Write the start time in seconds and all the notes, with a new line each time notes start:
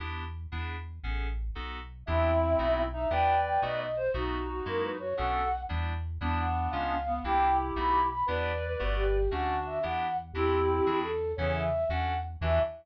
0.00 E2 B3 D4 E4 G4
0.52 E2 B3 D4 E4 G#4
1.03 A1 B3 C#4 G#4 A4
1.55 B1 B3 D#4 F#4 A4
2.06 E2 B3 C4 D4 E4 G4 E5
2.59 B1 A3 B3 D#4 F#4
2.93 D#4 E5
3.10 E2 B3 D4 E4 G4 B4 D5 G5
3.45 G5
3.62 B1 A3 B3 D#4 F#4 D#5
3.79 D#5
3.97 C5
4.14 B1 A3 B3 D#4 F#4
4.50 F#4
4.66 F#2 G#3 A#3 E4 F#4 A#4
4.83 B4
4.99 F#4 C#5
5.17 B1 A3 B3 C#4 D4 F#4 A4 F#5
5.69 E2 G3 B3 D4 E4
6.21 E2 G3 B3 D4 E4
6.40 F#5
6.70 C#2 G#3 B3 C#4 F4 F5
7.07 B3
7.24 C2 A#3 C4 D4 E4 G4 G5
7.76 B1 A3 B3 D#4 F#4 B5
8.10 B5
8.26 E2 B3 D4 E4 G4 B4 D5
8.79 G1 A3 B3 F#4 G4
8.96 G4
9.31 D2 A3 C#4 D4 F#4 F#5
9.66 E5
9.83 E2 B3 D4 E4 G4 F#5
10.33 E2 C4 D4 E4 F#4 G4
10.86 E2 D4 E4 F#4 G#4
11.03 A4
11.36 E2 C#3 E3 B3 C#4 E4 A4 C#5
11.55 E5
11.89 E2 C#4 D4 F#4 A4 F#5
12.41 E2 E3 D4 E4 F#4 G4 E5